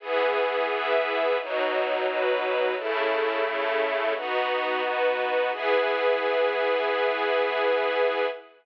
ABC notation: X:1
M:4/4
L:1/8
Q:1/4=87
K:E
V:1 name="String Ensemble 1"
[E,B,G]4 [B,,F,D]4 | [C,A,E]4 [B,DF]4 | [E,B,G]8 |]
V:2 name="String Ensemble 1"
[EGB]2 [EBe]2 [B,DF]2 [B,FB]2 | [CEA]2 [A,CA]2 [B,DF]2 [B,FB]2 | [EGB]8 |]